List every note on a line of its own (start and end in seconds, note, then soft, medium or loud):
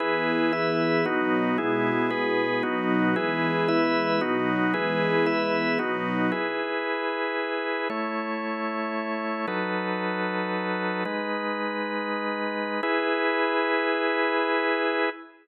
0.00 1.04 E3 medium
0.00 1.04 B3 medium
0.00 0.52 E4 loud
0.00 1.04 G#4 medium
0.00 0.52 G#4 medium
0.00 0.52 B4 loud
0.53 1.05 E4 medium
0.53 1.05 B4 medium
0.53 1.05 E5 medium
1.05 1.57 B2 medium
1.05 1.57 F#3 medium
1.05 1.57 B3 medium
1.05 1.57 D#4 medium
1.05 1.57 F#4 medium
1.58 2.62 B2 medium
1.58 2.62 G#3 medium
1.58 2.10 B3 medium
1.58 2.62 E4 medium
1.58 2.10 E4 medium
1.58 2.10 G#4 medium
2.10 2.63 B3 medium
2.10 2.63 G#4 medium
2.10 2.63 B4 medium
2.63 3.15 B2 medium
2.63 3.15 F#3 medium
2.63 3.15 B3 medium
2.63 3.15 D#4 medium
2.63 3.15 F#4 medium
3.16 4.20 E3 loud
3.16 4.20 G#3 medium
3.16 4.20 B3 medium
3.16 3.68 E4 medium
3.16 3.68 G#4 medium
3.16 3.68 B4 medium
3.68 4.21 E4 medium
3.68 4.21 B4 loud
3.68 4.21 E5 medium
4.21 4.73 B2 medium
4.21 4.73 F#3 medium
4.21 4.73 B3 medium
4.21 4.73 D#4 medium
4.21 4.73 F#4 medium
4.74 5.78 E3 loud
4.74 5.78 G#3 medium
4.74 5.78 B3 medium
4.74 5.26 E4 medium
4.74 5.26 G#4 medium
4.74 5.26 B4 medium
5.26 5.78 E4 medium
5.26 5.78 B4 medium
5.26 5.78 E5 medium
5.79 6.31 B2 medium
5.79 6.31 F#3 medium
5.79 6.31 B3 medium
5.79 6.31 D#4 medium
5.79 6.31 D#4 loud
5.79 6.31 F#4 medium
6.32 7.88 E4 medium
6.32 7.88 G#4 medium
6.32 7.88 B4 medium
7.90 9.46 A3 medium
7.90 9.46 E4 medium
7.90 9.46 C#5 medium
9.47 11.04 F#3 medium
9.47 11.04 D#4 medium
9.47 11.04 A4 medium
9.47 11.04 B4 medium
11.05 12.81 G#3 medium
11.05 12.81 D#4 medium
11.05 12.81 B4 medium
12.83 15.09 E4 loud
12.83 15.09 G#4 loud
12.83 15.09 B4 medium